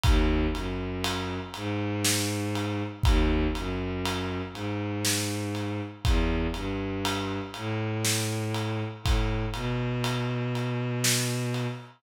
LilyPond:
<<
  \new Staff \with { instrumentName = "Violin" } { \clef bass \time 3/4 \key gis \minor \tempo 4 = 60 dis,8 fis,4 gis,4. | dis,8 fis,4 gis,4. | e,8 g,4 a,4. | a,8 b,2~ b,8 | }
  \new DrumStaff \with { instrumentName = "Drums" } \drummode { \time 3/4 <bd cymr>8 cymr8 cymr8 cymr8 sn8 cymr8 | <bd cymr>8 cymr8 cymr8 cymr8 sn8 cymr8 | <bd cymr>8 cymr8 cymr8 cymr8 sn8 cymr8 | <bd cymr>8 cymr8 cymr8 cymr8 sn8 cymr8 | }
>>